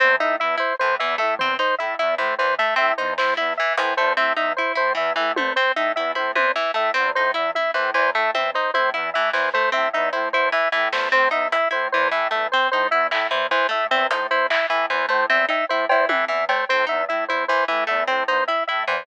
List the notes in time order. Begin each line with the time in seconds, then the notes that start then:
0.00 E2 C4 C5
0.20 A2 D#4 E5
0.40 E2 E4 E5
0.58 E4 C5
0.79 A2 E3 C5
0.99 E2 E3 E5
1.18 A2 A3 E5
1.39 E2 C4 C5, floor tom
1.59 D#4 C5
1.78 A2 E4 E5
1.99 E2 E4 E5
2.18 A2 E3 C5
2.38 E2 E3 C5
2.58 A3 E5
2.76 A2 C4 E5
2.98 E2 D#4 C5
3.18 A2 E4 C5, snare
3.37 E2 E4 E5
3.57 E3 E5
3.77 A2 E3 C5, closed hi-hat
3.97 E2 A3 C5
4.17 A2 C4 E5
4.37 E2 D#4 E5
4.57 E4 C5
4.75 A2 E4 C5
4.95 E2 E3 E5, kick
5.16 A2 E3 E5
5.36 E2 A3 C5, high tom
5.56 C4 C5
5.76 A2 D#4 E5
5.96 E2 E4 E5, cowbell
6.15 A2 E4 C5, high tom
6.35 E2 E3 C5, high tom
6.56 E3 E5
6.74 A2 A3 E5
6.94 E2 C4 C5
7.15 A2 D#4 C5
7.34 E2 E4 E5
7.55 E4 E5, high tom
7.74 A2 E3 C5
7.94 E2 E3 C5, clap
8.15 A2 A3 E5
8.34 E2 C4 E5, high tom
8.54 D#4 C5, kick
8.74 A2 E4 C5, high tom
8.94 E2 E4 E5
9.14 A2 E3 E5
9.33 E2 E3 C5, snare
9.54 A3 C5, kick
9.72 A2 C4 E5
9.93 E2 D#4 E5
10.13 A2 E4 C5
10.33 E2 E4 C5, kick
10.52 E3 E5
10.72 A2 E3 E5
10.92 E2 A3 C5, snare
11.12 A2 C4 C5
11.31 E2 D#4 E5
11.52 E4 E5, closed hi-hat
11.71 A2 E4 C5
11.92 E2 E3 C5
12.11 A2 E3 E5
12.31 E2 A3 E5
12.52 C4 C5
12.71 A2 D#4 C5
12.91 E2 E4 E5
13.11 A2 E4 E5, clap
13.31 E2 E3 C5
13.51 E3 C5, closed hi-hat
13.69 A2 A3 E5
13.91 E2 C4 E5
14.11 A2 D#4 C5, closed hi-hat
14.31 E2 E4 C5
14.50 E4 E5, clap
14.70 A2 E3 E5
14.90 E2 E3 C5, kick
15.09 A2 A3 C5
15.30 E2 C4 E5
15.49 D#4 E5, cowbell
15.69 A2 E4 C5
15.89 E2 E4 C5, cowbell
16.09 A2 E3 E5, high tom
16.28 E2 E3 E5
16.49 A3 C5, cowbell
16.69 A2 C4 C5
16.87 E2 D#4 E5
17.09 A2 E4 E5
17.28 E2 E4 C5
17.48 E3 C5
17.68 A2 E3 E5
17.87 E2 A3 E5
18.08 A2 C4 C5, cowbell
18.28 E2 D#4 C5
18.48 E4 E5, cowbell
18.67 A2 E4 E5
18.87 E2 E3 C5, cowbell